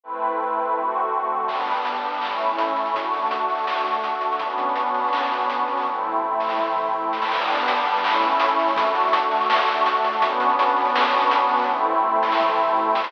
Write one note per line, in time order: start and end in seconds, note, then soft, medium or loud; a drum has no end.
0.04 0.76 A3 medium
0.04 0.76 C4 medium
0.04 0.76 E4 medium
0.04 0.76 B4 medium
0.76 1.48 D3 medium
0.76 1.48 A3 medium
0.76 1.48 C4 medium
0.76 1.48 F#4 medium
1.48 2.22 G3 medium
1.48 2.22 B3 medium
1.48 2.22 D4 medium
1.48 kick medium
1.48 crash loud
1.58 closed hi-hat medium
1.67 kick medium
1.67 closed hi-hat medium
1.73 closed hi-hat medium
1.77 closed hi-hat medium
1.82 closed hi-hat medium
1.85 closed hi-hat loud
1.95 closed hi-hat medium
2.04 closed hi-hat medium
2.14 closed hi-hat medium
2.21 2.94 A3 medium
2.21 2.94 C#4 medium
2.21 2.94 E4 medium
2.21 clap loud
2.31 closed hi-hat medium
2.41 closed hi-hat medium
2.49 kick medium
2.49 closed hi-hat medium
2.58 closed hi-hat loud
2.68 closed hi-hat medium
2.76 closed hi-hat medium
2.85 snare medium
2.85 closed hi-hat medium
2.95 4.39 A3 medium
2.95 4.39 D4 medium
2.95 4.39 F#4 medium
2.95 kick loud
2.95 closed hi-hat loud
3.04 closed hi-hat medium
3.12 kick medium
3.12 closed hi-hat medium
3.17 closed hi-hat medium
3.22 closed hi-hat medium
3.26 closed hi-hat medium
3.31 closed hi-hat loud
3.39 closed hi-hat medium
3.49 closed hi-hat medium
3.55 closed hi-hat medium
3.58 closed hi-hat medium
3.63 snare loud
3.63 closed hi-hat medium
3.77 closed hi-hat medium
3.86 closed hi-hat medium
3.94 kick medium
3.94 closed hi-hat medium
4.04 closed hi-hat medium
4.14 closed hi-hat medium
4.21 closed hi-hat medium
4.32 snare medium
4.32 closed hi-hat medium
4.39 5.85 B3 medium
4.39 5.85 C#4 medium
4.39 5.85 D4 medium
4.39 5.85 F#4 medium
4.39 kick medium
4.39 closed hi-hat loud
4.50 closed hi-hat medium
4.58 kick medium
4.58 closed hi-hat medium
4.69 closed hi-hat medium
4.76 closed hi-hat loud
4.86 closed hi-hat medium
4.94 closed hi-hat medium
4.99 closed hi-hat medium
5.04 closed hi-hat medium
5.08 closed hi-hat medium
5.13 snare loud
5.22 closed hi-hat medium
5.31 snare soft
5.31 closed hi-hat medium
5.40 kick medium
5.40 closed hi-hat medium
5.50 closed hi-hat loud
5.59 closed hi-hat medium
5.68 closed hi-hat medium
5.73 closed hi-hat medium
5.77 snare medium
5.77 closed hi-hat medium
5.82 7.30 A3 medium
5.82 7.30 C4 medium
5.82 7.30 E4 medium
5.82 kick medium
5.82 closed hi-hat medium
5.82 high tom medium
5.95 high tom medium
6.04 mid tom medium
6.13 mid tom medium
6.31 floor tom medium
6.40 snare medium
6.49 snare medium
6.58 high tom loud
6.67 high tom medium
6.76 mid tom medium
6.85 mid tom medium
6.94 floor tom loud
7.04 floor tom medium
7.13 snare medium
7.22 snare loud
7.32 8.03 G3 loud
7.32 8.03 B3 medium
7.32 8.03 D4 medium
7.32 kick loud
7.32 crash loud
7.41 closed hi-hat medium
7.48 kick loud
7.48 closed hi-hat medium
7.54 closed hi-hat medium
7.60 closed hi-hat medium
7.63 closed hi-hat medium
7.68 closed hi-hat loud
7.76 closed hi-hat medium
7.85 closed hi-hat medium
7.96 closed hi-hat medium
8.04 8.76 A3 medium
8.04 8.76 C#4 loud
8.04 8.76 E4 loud
8.04 clap loud
8.13 closed hi-hat medium
8.21 closed hi-hat medium
8.32 kick medium
8.32 closed hi-hat medium
8.40 closed hi-hat loud
8.49 closed hi-hat medium
8.59 closed hi-hat medium
8.68 snare medium
8.68 closed hi-hat medium
8.76 10.21 A3 medium
8.76 10.21 D4 medium
8.76 10.21 F#4 loud
8.76 kick loud
8.76 closed hi-hat loud
8.86 closed hi-hat medium
8.95 kick medium
8.95 closed hi-hat loud
9.00 closed hi-hat medium
9.04 closed hi-hat medium
9.08 closed hi-hat medium
9.13 closed hi-hat loud
9.22 closed hi-hat medium
9.31 closed hi-hat medium
9.36 closed hi-hat medium
9.41 closed hi-hat medium
9.44 closed hi-hat medium
9.50 snare loud
9.58 closed hi-hat medium
9.67 closed hi-hat medium
9.77 kick loud
9.77 closed hi-hat medium
9.86 closed hi-hat loud
9.96 closed hi-hat medium
10.04 closed hi-hat loud
10.13 snare medium
10.13 closed hi-hat medium
10.22 11.66 B3 loud
10.22 11.66 C#4 medium
10.22 11.66 D4 loud
10.22 11.66 F#4 medium
10.22 kick loud
10.22 closed hi-hat loud
10.30 closed hi-hat medium
10.40 kick loud
10.40 closed hi-hat loud
10.49 closed hi-hat medium
10.59 closed hi-hat loud
10.68 closed hi-hat medium
10.76 closed hi-hat medium
10.81 closed hi-hat medium
10.85 closed hi-hat medium
10.89 closed hi-hat medium
10.96 snare loud
11.04 closed hi-hat medium
11.13 snare soft
11.13 closed hi-hat medium
11.22 kick loud
11.22 closed hi-hat medium
11.31 closed hi-hat loud
11.40 closed hi-hat medium
11.49 closed hi-hat medium
11.54 closed hi-hat medium
11.57 snare medium
11.57 closed hi-hat medium
11.64 13.12 A3 loud
11.64 13.12 C4 medium
11.64 13.12 E4 medium
11.64 kick medium
11.64 closed hi-hat medium
11.69 high tom medium
11.78 high tom medium
11.86 mid tom medium
11.94 mid tom medium
12.14 floor tom loud
12.23 snare loud
12.32 snare loud
12.40 high tom loud
12.48 high tom loud
12.58 mid tom loud
12.67 mid tom loud
12.77 floor tom loud
12.86 floor tom loud
12.95 snare loud
13.04 snare loud